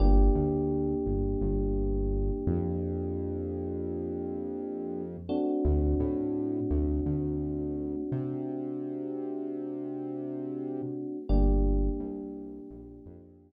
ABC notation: X:1
M:4/4
L:1/8
Q:1/4=85
K:Gm
V:1 name="Electric Piano 1"
[B,DG]8- | [B,DG]7 [A,CD^F]- | [A,CD^F]8- | [A,CD^F]8 |
[B,DG]8 |]
V:2 name="Synth Bass 1" clef=bass
G,,, D,,2 G,,, G,,,3 F,,- | F,,8 | D,, A,,2 D,, D,,3 C,- | C,8 |
G,,,2 C,,2 B,,, F,,2 z |]